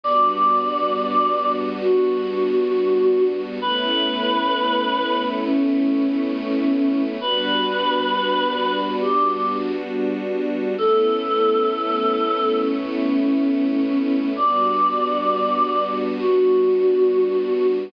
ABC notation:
X:1
M:4/4
L:1/8
Q:1/4=67
K:Amix
V:1 name="Choir Aahs"
d4 F4 | B4 C4 | B4 G z3 | A4 C4 |
d4 F4 |]
V:2 name="String Ensemble 1"
[G,B,DF]8 | [A,B,CE]8 | [G,B,DF]8 | [A,B,CE]8 |
[G,B,DF]8 |]